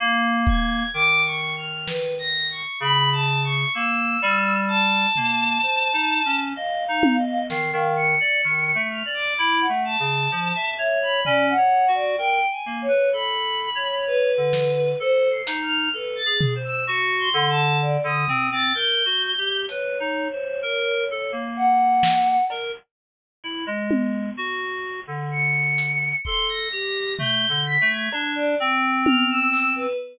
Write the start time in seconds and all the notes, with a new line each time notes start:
0.00 A#3
0.47 G#6, kick
0.94 D#3 D6
1.25 C#6
1.56 F6
1.86 B4, snare
2.19 A#6
2.51 C#6
2.80 C#3 B5
3.12 A5
3.44 C#6
3.74 A#3 E6
4.22 G3
4.68 A5
5.16 A#3, floor tom
5.62 C5
5.93 D#4
6.25 C#4
6.56 D#5 F5
6.88 D#4
7.03 high tom
7.18 D#5
7.50 D#3 C7, snare
7.73 D#3 F5
7.96 C#7
8.20 D5
8.44 D#3
8.75 A3
8.90 F6
9.05 D5
9.14 D6
9.38 E4
9.60 F#5
9.69 A3
9.85 A5
10.00 C#3
10.31 F3
10.55 E5
10.78 C#5 E5
11.02 B5
11.24 C#4 D5, floor tom
11.50 F#5
11.57 C#5
11.88 F#4
11.95 D5
12.18 A#4 G5
12.51 G#5
12.66 A#3
12.82 C#5
12.88 B4
13.13 A4 B5
13.75 C#5
14.07 B4
14.37 D3
14.53 snare
15.00 A4 C5
15.31 C7
15.47 D#4, closed hi-hat
15.62 F6
15.93 A4 B4
16.16 A6
16.26 G#4
16.41 floor tom
16.55 C5
16.64 E6
16.87 F#4 C#7
17.19 C6
17.34 D3
17.49 A5
17.82 D5
18.04 D3 D#6
18.28 C4, floor tom
18.52 C4 A6
18.74 A#4 G6
19.05 F#4
19.38 G4
19.68 B4 C#5, closed hi-hat
20.00 D#4
20.32 C5
20.62 A#4
21.11 A4
21.32 A#3
21.56 F#5
22.03 snare
22.50 A#4, cowbell
23.44 E4
23.66 G#3
23.91 high tom
24.37 F#4
25.07 D3
25.32 C#7
25.78 closed hi-hat
26.25 A4 C6, kick
26.49 A#6
26.72 G4
27.19 A3 G6, floor tom
27.49 D3
27.66 B6
27.81 A3
27.89 G#6
28.12 D4, cowbell
28.36 D5
28.60 C4
29.05 F6, high tom
29.30 E6
29.53 clap
29.76 B4